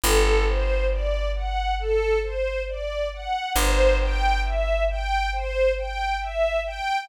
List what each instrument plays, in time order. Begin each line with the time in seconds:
0.03 electric bass (finger) G1, string ensemble 1 A4
0.46 string ensemble 1 C5
0.91 string ensemble 1 D5
1.35 string ensemble 1 F#5
1.79 string ensemble 1 A4
2.23 string ensemble 1 C5
2.69 string ensemble 1 D5
3.13 string ensemble 1 F#5
3.56 electric bass (finger) G1, string ensemble 1 C5
4.01 string ensemble 1 G5
4.44 string ensemble 1 E5
4.90 string ensemble 1 G5
5.33 string ensemble 1 C5
5.78 string ensemble 1 G5
6.21 string ensemble 1 E5
6.66 string ensemble 1 G5